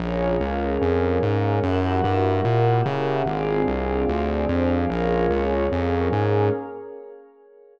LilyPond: <<
  \new Staff \with { instrumentName = "Pad 2 (warm)" } { \time 4/4 \key bes \minor \tempo 4 = 147 <bes des' f' aes'>2 <bes des' aes' bes'>2 | <bes fes' ges' g'>2 <bes fes' g' bes'>2 | <c' d' f' aes'>2 <c' d' aes' c''>2 | <bes des' f' aes'>2 <bes des' aes' bes'>2 | }
  \new Staff \with { instrumentName = "Pad 5 (bowed)" } { \time 4/4 \key bes \minor <aes' bes' des'' f''>1 | <g' bes' fes'' ges''>1 | <aes' c'' d'' f''>1 | <aes' bes' des'' f''>1 | }
  \new Staff \with { instrumentName = "Synth Bass 1" } { \clef bass \time 4/4 \key bes \minor bes,,4 des,4 f,4 aes,4 | ges,4 g,4 bes,4 des4 | aes,,4 c,4 d,4 f,4 | bes,,4 des,4 f,4 aes,4 | }
>>